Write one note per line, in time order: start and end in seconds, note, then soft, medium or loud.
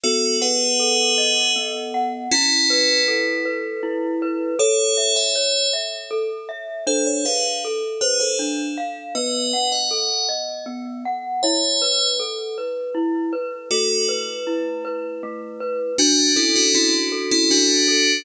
0.03 1.55 B3 medium
0.03 0.36 F#4 loud
0.03 0.36 A4 loud
0.41 1.51 G#4 medium
0.41 1.51 B4 loud
0.41 1.94 F#5 medium
0.80 2.24 A4 medium
1.18 2.26 D#5 medium
1.56 2.28 B3 medium
1.94 2.30 F#5 medium
2.31 3.00 C#4 loud
2.31 3.00 E4 loud
2.31 3.82 E4 medium
2.70 3.45 B4 medium
3.08 4.52 A4 medium
3.45 4.22 B4 medium
3.83 4.55 E4 medium
4.22 4.58 B4 medium
4.59 4.97 A4 medium
4.59 5.15 A4 loud
4.59 5.15 C#5 loud
4.97 5.35 E5 medium
5.16 5.68 C#5 medium
5.16 5.68 E5 loud
5.35 5.73 C#5 medium
5.73 6.11 E5 medium
6.11 6.49 A4 medium
6.49 6.85 E5 medium
6.87 7.25 D4 medium
6.87 7.05 A4 loud
6.87 7.05 C5 loud
7.06 7.24 C#5 medium
7.25 7.43 G#4 medium
7.25 7.43 B4 medium
7.25 7.64 F5 medium
7.65 8.03 A4 medium
8.01 8.19 G#4 medium
8.01 8.19 B4 loud
8.01 8.39 C5 medium
8.20 8.38 A4 medium
8.20 8.38 C5 medium
8.39 8.77 D4 medium
8.78 9.14 F5 medium
9.15 9.53 B3 medium
9.15 9.68 B4 medium
9.15 9.68 D#5 loud
9.53 9.91 F#5 medium
9.72 10.26 D#5 medium
9.72 10.26 F#5 medium
9.91 10.29 A4 medium
10.29 10.67 D#5 medium
10.66 11.04 B3 medium
11.05 11.41 F#5 medium
11.43 11.82 E4 medium
11.43 12.06 C#5 loud
11.43 12.06 E5 loud
11.82 12.20 B4 medium
12.20 12.58 A4 medium
12.58 12.96 B4 medium
12.95 13.33 E4 medium
13.33 13.69 B4 medium
13.71 15.23 A3 medium
13.71 14.05 F#4 loud
13.71 14.05 A4 loud
14.09 14.84 B4 medium
14.47 15.91 E4 medium
14.85 15.60 B4 medium
15.23 15.95 A3 medium
15.60 15.97 B4 medium
15.98 16.32 D4 loud
15.98 17.50 D4 medium
15.98 16.32 F#4 loud
16.36 16.54 C#4 medium
16.36 16.54 E4 loud
16.36 17.12 A4 medium
16.56 16.74 D4 medium
16.56 16.74 F#4 loud
16.74 16.92 C#4 loud
16.74 16.92 E4 loud
16.74 18.19 F#4 medium
17.12 17.88 A4 medium
17.31 17.50 C#4 medium
17.31 17.50 E4 loud
17.51 18.19 D4 medium
17.51 18.23 D4 medium
17.51 18.19 F#4 loud
17.88 18.24 A4 medium